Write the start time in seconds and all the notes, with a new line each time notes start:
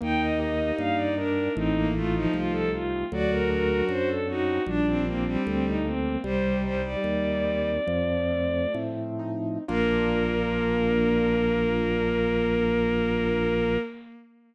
0.01 D#2 A#3 D#4 G5
0.20 D#5
0.39 G4 D#5
0.78 G2 A#3 F5
0.96 D5
1.16 D4 D#4 A#4
1.55 A1 A3 C4 D#4
1.74 A#3
1.94 A3 D#4 F4
2.14 F3 D#4
2.33 C2 A3 F4
2.52 A4
2.73 C4 F4
3.12 D2 F#3 F#4 D5
3.31 A#4
3.50 D4 A#4
3.89 F#2 F#3 C5
4.08 A4
4.28 C4 D#4 F#4
4.66 A#1 G3 D4
4.87 C4
5.05 A#3 C4 D4
5.24 G3 C4
5.45 D2 G3 C4
5.67 D#4
5.85 A#3 C4
6.23 C2 G3 C5
6.62 G3 D#4 C5
6.82 G3 D5
7.01 D#2 G3
7.44 C4
7.87 F2 F3
8.30 A3
8.74 A2 C4
9.19 D#4
9.68 A#1 A#3 D4 F4 A#4